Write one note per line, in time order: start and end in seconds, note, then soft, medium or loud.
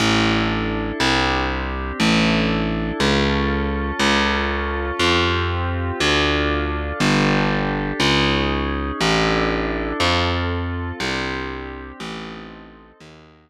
0.00 0.92 A1 loud
0.00 0.99 D4 medium
0.00 0.99 E4 medium
0.00 0.99 A4 loud
0.99 1.92 C2 loud
0.99 1.98 C4 medium
0.99 1.98 D4 medium
0.99 1.98 G4 medium
2.00 2.92 A1 loud
2.00 2.99 D4 medium
2.00 2.99 E4 loud
2.00 2.99 A4 medium
3.00 3.92 C#2 loud
3.00 4.00 C#4 medium
3.00 4.00 F4 medium
3.00 4.00 A4 loud
3.99 4.92 C#2 loud
3.99 4.99 C#4 loud
3.99 4.99 F4 loud
3.99 4.99 A4 loud
4.99 5.92 F2 loud
4.99 5.99 C4 loud
4.99 5.99 F4 loud
4.99 5.99 G4 medium
5.99 6.92 D2 loud
5.99 6.98 D4 loud
5.99 6.98 F4 loud
5.99 6.98 A4 medium
7.00 7.92 G1 loud
7.00 7.99 D4 medium
7.00 7.99 G4 medium
7.00 7.99 A4 medium
7.99 8.92 C#2 loud
7.99 8.98 C#4 medium
7.99 8.98 D#4 medium
7.99 8.98 G#4 medium
8.99 9.93 A1 loud
8.99 9.98 D4 loud
8.99 9.98 E4 loud
8.99 9.98 A4 medium
10.00 10.92 F2 loud
10.00 10.99 C4 medium
10.00 10.99 F4 medium
10.00 10.99 A4 loud
11.00 11.92 C2 loud
11.00 11.99 C4 medium
11.00 11.99 D4 medium
11.00 11.99 G4 loud
11.99 12.92 A1 loud
11.99 12.98 C4 loud
11.99 12.98 D#4 loud
11.99 12.98 A4 medium
13.00 13.50 D#2 loud
13.00 13.50 D#4 loud
13.00 13.50 F#4 loud
13.00 13.50 A#4 loud